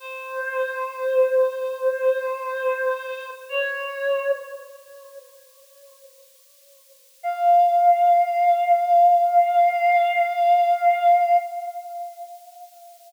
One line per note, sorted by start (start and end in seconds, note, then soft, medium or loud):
0.00 3.30 C5 medium
3.49 4.31 C#5 medium
7.23 11.37 F5 loud